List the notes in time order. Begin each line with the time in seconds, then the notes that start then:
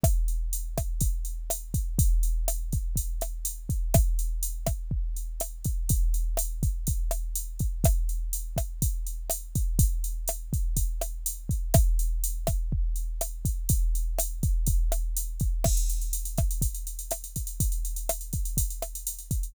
0.03 kick, cross-stick, closed hi-hat
0.28 closed hi-hat
0.53 closed hi-hat
0.78 kick, cross-stick, closed hi-hat
1.01 kick, closed hi-hat
1.25 closed hi-hat
1.50 cross-stick, closed hi-hat
1.74 kick, closed hi-hat
1.99 kick, closed hi-hat
2.23 closed hi-hat
2.48 cross-stick, closed hi-hat
2.72 kick, closed hi-hat
2.96 kick, closed hi-hat
3.21 cross-stick, closed hi-hat
3.45 closed hi-hat
3.69 kick, closed hi-hat
3.94 kick, cross-stick, closed hi-hat
4.19 closed hi-hat
4.43 closed hi-hat
4.66 kick, cross-stick, closed hi-hat
4.91 kick
5.16 closed hi-hat
5.40 cross-stick, closed hi-hat
5.64 kick, closed hi-hat
5.89 kick, closed hi-hat
6.14 closed hi-hat
6.37 cross-stick, closed hi-hat
6.63 kick, closed hi-hat
6.87 kick, closed hi-hat
7.11 cross-stick, closed hi-hat
7.35 closed hi-hat
7.59 kick, closed hi-hat
7.84 kick, cross-stick, closed hi-hat
8.09 closed hi-hat
8.33 closed hi-hat
8.57 kick, cross-stick, closed hi-hat
8.82 kick, closed hi-hat
9.07 closed hi-hat
9.30 cross-stick, closed hi-hat
9.55 kick, closed hi-hat
9.79 kick, closed hi-hat
10.04 closed hi-hat
10.28 cross-stick, closed hi-hat
10.53 kick, closed hi-hat
10.77 kick, closed hi-hat
11.01 cross-stick, closed hi-hat
11.26 closed hi-hat
11.49 kick, closed hi-hat
11.74 kick, cross-stick, closed hi-hat
11.99 closed hi-hat
12.24 closed hi-hat
12.47 kick, cross-stick, closed hi-hat
12.72 kick
12.96 closed hi-hat
13.21 cross-stick, closed hi-hat
13.45 kick, closed hi-hat
13.69 kick, closed hi-hat
13.95 closed hi-hat
14.18 cross-stick, closed hi-hat
14.43 kick, closed hi-hat
14.67 kick, closed hi-hat
14.92 cross-stick, closed hi-hat
15.17 closed hi-hat
15.40 kick, closed hi-hat
15.64 kick, cross-stick, crash
15.77 closed hi-hat
15.90 closed hi-hat
16.02 closed hi-hat
16.13 closed hi-hat
16.25 closed hi-hat
16.38 kick, cross-stick, closed hi-hat
16.51 closed hi-hat
16.61 kick, closed hi-hat
16.74 closed hi-hat
16.87 closed hi-hat
16.99 closed hi-hat
17.11 cross-stick, closed hi-hat
17.24 closed hi-hat
17.36 kick, closed hi-hat
17.47 closed hi-hat
17.60 kick, closed hi-hat
17.72 closed hi-hat
17.85 closed hi-hat
17.96 closed hi-hat
18.09 cross-stick, closed hi-hat
18.21 closed hi-hat
18.33 kick, closed hi-hat
18.45 closed hi-hat
18.57 kick, closed hi-hat
18.70 closed hi-hat
18.82 cross-stick, closed hi-hat
18.95 closed hi-hat
19.07 closed hi-hat
19.19 closed hi-hat
19.31 kick, closed hi-hat
19.43 closed hi-hat